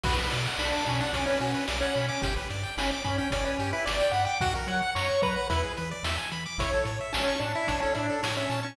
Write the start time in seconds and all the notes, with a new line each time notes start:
0.04 B1 F#4 B4, kick, crash
0.19 B4
0.31 B2 D5, closed hi-hat
0.46 F#5
0.58 B1 D4 B5, snare
0.72 D6
0.86 B2 C#4 B5, kick, closed hi-hat
1.00 D4 F#5
1.13 B1 C#4 D5, kick, closed hi-hat
1.26 C#4 B4
1.40 B2 C#4 F#4, closed hi-hat
1.54 B4
1.68 B1 D5, snare
1.80 C#4 F#5
1.95 B2 B5, closed hi-hat
2.08 C#4 D6
2.22 G1 G4, kick, closed hi-hat
2.36 B4
2.50 G2 D5, closed hi-hat
2.63 G5
2.77 G1 C#4 B5, snare
2.91 D6
3.04 G2 C#4 B5, kick, closed hi-hat
3.18 C#4 G5
3.30 G1 C#4 D5, kick, closed hi-hat
3.45 C#4 B4
3.59 G2 G4, closed hi-hat
3.73 E4 B4
3.86 G1 D5, snare
4.00 G5
4.11 G2 F#5 B5, closed hi-hat
4.25 G5 D6
4.40 F#2 F#4 F#5, kick, closed hi-hat
4.55 A#4
4.67 F#3 C#5 F#5, closed hi-hat
4.82 F#5
4.95 F#2 C#5 A#5, snare
5.09 C#6
5.22 F#3 B4 A#5, kick, closed hi-hat
5.36 F#5
5.50 E2 E4 B4, kick, closed hi-hat
5.64 G#4
5.77 E3 B4, closed hi-hat
5.91 D5
6.03 E2 E5, snare
6.18 G#5
6.32 E3 B5, closed hi-hat
6.46 D6
6.58 A1 E4 C#5, kick, closed hi-hat
6.73 A4
6.85 A2 C#5, closed hi-hat
7.01 E5
7.13 A1 C#4 A5, snare
7.28 C#6
7.39 A2 D4 A5, closed hi-hat
7.55 E4 E5
7.67 A1 D4 C#5, kick, closed hi-hat
7.80 C#4 A4
7.94 A2 D4 E4, closed hi-hat
8.10 A4
8.23 A2 C#5, snare
8.37 C#4 E5
8.50 A#2 A5, closed hi-hat
8.63 C#4 C#6